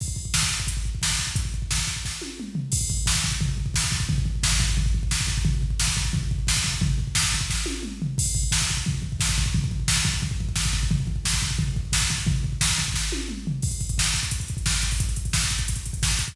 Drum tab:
CC |x---------------|----------------|x---------------|----------------|
HH |--------x-------|x---------------|----------------|----------------|
SD |----o-------o---|----o---o-------|----o-------o---|----o-------o---|
T1 |----------------|----------o-----|----------------|----------------|
T2 |----------------|------------o---|----------------|----------------|
FT |----------------|--------------o-|--o---o-o-o---o-|o-o---o-o-o---o-|
BD |oooooooooooooooo|ooooooooo-------|oooooooooooooooo|oooooooooooooooo|

CC |----------------|----------------|x---------------|----------------|
HH |----------------|----------------|----------------|----------------|
SD |----o-------o---|----o---o-------|----o-------o---|----o-------o---|
T1 |----------------|----------o-----|----------------|----------------|
T2 |----------------|------------o---|----------------|----------------|
FT |o-o---o-o-o---o-|o-o---o-------o-|--o---o-o-o---o-|o-o---o-o-o---o-|
BD |oooooooooooooooo|ooooooooo-------|oooooooooooooooo|oooooooooooooooo|

CC |----------------|----------------|x---------------|----------------|
HH |----------------|----------------|-xxx-xxxxxxx-xxo|xxxx-xxxxxxx-xxx|
SD |----o-------o---|----o---o-------|----o-------o---|----o-------o---|
T1 |----------------|----------o-----|----------------|----------------|
T2 |----------------|------------o---|----------------|----------------|
FT |o-o---o-o-o---o-|o-o---o-------o-|----------------|----------------|
BD |oooooooooooooooo|ooooooooo-------|oooooooooooooooo|oooooooooooooooo|